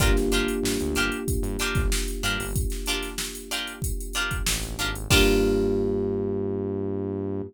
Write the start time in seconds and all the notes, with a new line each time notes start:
0.00 G1 A#3 D4 F4 G4 A#4, kick, closed hi-hat
0.15 G1, snare, closed hi-hat
0.32 G1 D4 F4 G4 A#4, closed hi-hat
0.48 closed hi-hat
0.63 G2, snare
0.80 D2, closed hi-hat
0.95 G1 D4 F4 G4 A#4, closed hi-hat
1.12 closed hi-hat
1.28 kick, closed hi-hat
1.42 G2, closed hi-hat
1.59 D4 F4 G4 A#4, closed hi-hat
1.75 G1, kick, snare, closed hi-hat
1.92 snare
2.08 closed hi-hat
2.23 G2 D4 F4 G4 A#4, snare, closed hi-hat
2.39 G1, open hi-hat
2.56 kick, closed hi-hat
2.70 snare, closed hi-hat
2.86 D4 F4 G4 A#4, closed hi-hat
3.03 snare, closed hi-hat
3.18 snare
3.35 closed hi-hat
3.51 D4 F4 G4 A#4, closed hi-hat
3.67 closed hi-hat
3.82 kick, closed hi-hat
4.00 closed hi-hat
4.13 D4 F4 G4 A#4, closed hi-hat
4.31 kick, closed hi-hat
4.46 A1, snare
4.63 snare, closed hi-hat
4.79 G#1 D4 F4 G4 A#4, closed hi-hat
4.95 closed hi-hat
5.10 G2 A#3 D4 F4 G4 A#4, kick, crash